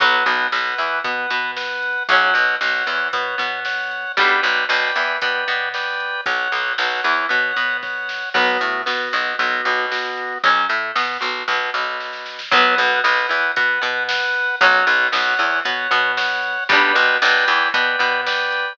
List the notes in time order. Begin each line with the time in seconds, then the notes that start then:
0.00 B1 F#3 B3 B4 F#5, kick, closed hi-hat
0.26 B1 B2, closed hi-hat
0.52 B1 B2 B4 F#5, snare
0.78 E2 E3, closed hi-hat
1.04 B2 B3 B4 F#5, kick, closed hi-hat
1.30 B2 B3, closed hi-hat
1.57 B4 F#5, snare
1.82 closed hi-hat
2.08 B1 F#3 C#4 C#5 F#5, kick, closed hi-hat
2.34 B1 B2, closed hi-hat
2.61 B1 B2 C#5 F#5, snare
2.87 E2 E3, closed hi-hat
3.13 B2 B3 C#5 F#5, kick, closed hi-hat
3.38 B2 B3, closed hi-hat
3.65 C#5 F#5, snare
3.91 closed hi-hat
4.17 B1 G3 B3 D4 B4 D5 G5, kick, closed hi-hat
4.43 B1 B2, closed hi-hat
4.69 B1 B2 B4 D5 G5, snare
4.96 E2 E3, closed hi-hat
5.21 B2 B3 B4 D5 G5, kick, closed hi-hat
5.48 B2 B3, closed hi-hat
5.74 B4 D5 G5, snare
6.00 closed hi-hat
6.26 B1 C#5 F#5, kick, closed hi-hat
6.52 B1 B2, closed hi-hat
6.78 B1 B2 C#5 F#5, snare
7.04 E2 E3, closed hi-hat
7.29 B2 B3 C#5 F#5, kick, closed hi-hat
7.57 B2 B3, closed hi-hat
7.82 C#5 F#5, kick, snare
8.09 snare
8.34 B1 F#3 B3 F#4, kick, crash
8.61 A2 A3, closed hi-hat
8.86 B2 B3 F#4, snare
9.13 B1 B2, closed hi-hat
9.39 B1 B2 B3 F#4, kick, closed hi-hat
9.65 B1 B2, closed hi-hat
9.91 B3 F#4, snare
10.17 closed hi-hat
10.44 B1 F#3 C#4, kick, closed hi-hat
10.69 A2 A3, closed hi-hat
10.95 B2 B3, snare
11.21 B1 B2, closed hi-hat
11.48 B1 B2, kick, snare
11.74 B1 B2, snare
12.00 snare
12.13 snare
12.26 snare
12.39 snare
12.51 B1 F#3 B3 B4 F#5, kick, closed hi-hat
12.78 B1 B2, closed hi-hat
13.04 B1 B2 B4 F#5, snare
13.29 E2 E3, closed hi-hat
13.56 B2 B3 B4 F#5, kick, closed hi-hat
13.82 B2 B3, closed hi-hat
14.09 B4 F#5, snare
14.34 closed hi-hat
14.61 B1 F#3 C#4 C#5 F#5, kick, closed hi-hat
14.87 B1 B2, closed hi-hat
15.12 B1 B2 C#5 F#5, snare
15.39 E2 E3, closed hi-hat
15.65 B2 B3 C#5 F#5, kick, closed hi-hat
15.91 B2 B3, closed hi-hat
16.17 C#5 F#5, snare
16.43 closed hi-hat
16.69 B1 G3 B3 D4 B4 D5 G5, kick, closed hi-hat
16.95 B1 B2, closed hi-hat
17.22 B1 B2 B4 D5 G5, snare
17.47 E2 E3, closed hi-hat
17.74 B2 B3 B4 D5 G5, kick, closed hi-hat
17.99 B2 B3, closed hi-hat
18.26 B4 D5 G5, snare
18.52 closed hi-hat